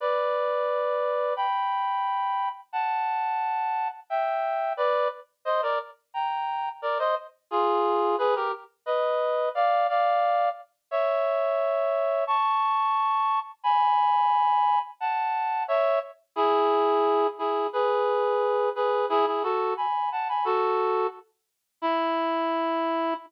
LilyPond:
\new Staff { \time 2/4 \key d \major \tempo 4 = 88 <b' d''>2 | <g'' b''>2 | <fis'' a''>2 | <e'' g''>4 <b' d''>8 r8 |
\key ees \major <c'' ees''>16 <bes' d''>16 r8 <g'' bes''>4 | <bes' d''>16 <c'' ees''>16 r8 <f' aes'>4 | <aes' ces''>16 <g' bes'>16 r8 <ces'' ees''>4 | <d'' f''>8 <d'' f''>4 r8 |
\key e \major <cis'' e''>2 | <a'' cis'''>2 | <gis'' b''>2 | <fis'' a''>4 <cis'' e''>8 r8 |
<e' gis'>4. <e' gis'>8 | <gis' b'>4. <gis' b'>8 | <e' gis'>16 <e' gis'>16 <fis' a'>8 <gis'' b''>8 <fis'' a''>16 <gis'' b''>16 | <fis' a'>4 r4 |
e'2 | }